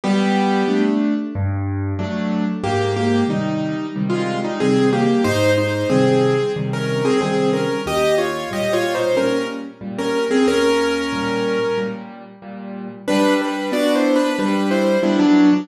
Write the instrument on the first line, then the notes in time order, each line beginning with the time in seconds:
acoustic grand piano
0.04 G3 B3 G4
0.68 A3 D4
1.35 G2
1.99 F#3 A3 D4
2.63 G#2 A#3 G4
2.96 A#3 G4
3.28 C3 D#3 G3 D#4
3.96 C3 D#3 G3
4.10 G#3 F4
4.44 G3 D#4
4.60 C3 D#3 G3 C4 G#4
4.93 A#3 G4
5.24 G#2 D#4 C5
5.58 D#4 C5
5.90 C3 D#3 G3 C4 G#4
6.56 C3 D#3 G3
6.73 C#4 A#4
7.05 C4 G#4
7.21 C3 D#3 G3 C4 G#4
7.53 C#4 A#4
7.86 D#2 G4 D#5
8.18 F4 C#5
8.51 A#2 G3 G4 D#5
8.73 F4 C#5
8.95 D#4 C5
9.15 A#2 G3 C#4 A#4
9.81 A#2 G3
9.99 C#4 A#4
10.31 C4 G#4
10.47 D#2 C#4 A#4
11.13 A#2 G3
11.78 A#2 G3
12.42 A#2 G3
13.08 G3 D4 B4
13.42 D4 B4
13.72 B3 D4 F#4 D5
13.95 E4 C5
14.16 D4 B4
14.38 G3 D4 B4
14.71 E4 C5
15.03 G3 B3 D4 E4
15.19 F#3 D4
15.53 F#3 D4